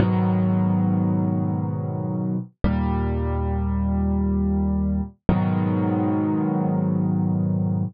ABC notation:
X:1
M:4/4
L:1/8
Q:1/4=91
K:G#m
V:1 name="Acoustic Grand Piano" clef=bass
[G,,B,,D,F,]8 | [D,,A,,=G,]8 | [G,,B,,D,F,]8 |]